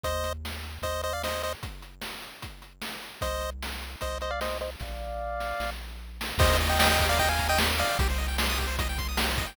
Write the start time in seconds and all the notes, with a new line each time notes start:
0.03 D#2 C5 D#5, kick, closed hi-hat
0.24 closed hi-hat
0.45 snare
0.63 closed hi-hat
0.82 D#2 C5 D#5, kick, closed hi-hat
1.03 C5 D#5, closed hi-hat
1.13 D5 F5
1.23 C5 D#5, snare
1.43 C5 D#5, closed hi-hat
1.63 kick, closed hi-hat
1.82 closed hi-hat
2.01 snare
2.22 closed hi-hat
2.42 kick, closed hi-hat
2.62 closed hi-hat
2.82 snare
3.03 closed hi-hat
3.21 C2 C5 D#5, kick, closed hi-hat
3.41 closed hi-hat
3.63 snare
3.82 closed hi-hat
4.01 C2 C5 D#5, kick, closed hi-hat
4.21 C5 D#5, closed hi-hat
4.31 D5 F5
4.41 C5 D#5, snare
4.61 C5 D#5, closed hi-hat
4.80 A#1 D5 F5, kick, snare
5.40 snare
5.60 A#1, snare
6.21 snare
6.38 D#2 G4 C5 D#5, kick, crash
6.49 A#4
6.60 D#5, closed hi-hat
6.69 D#5 G5
6.79 D#5 G5 A#5, snare
6.89 D#5 G5 D#6
6.99 G4, kick, closed hi-hat
7.09 A#4 D5 F5
7.18 D#5 G5, kick, closed hi-hat
7.29 F5 G5 G#5
7.39 A#5, kick, closed hi-hat
7.49 D#5 G5 D#6
7.58 G4, snare
7.70 A#4
7.78 D5 D#5 F5, closed hi-hat
7.89 G5
7.99 C2 G4, kick, closed hi-hat
8.09 C5
8.18 D#5, closed hi-hat
8.28 G5
8.38 C6, snare
8.50 D#6
8.58 G4, kick, closed hi-hat
8.67 C5
8.78 D#5, kick, closed hi-hat
8.89 G5
8.98 C6, kick, closed hi-hat
9.09 D#6
9.17 G4, snare
9.29 C5
9.38 D#5, kick, closed hi-hat
9.47 G5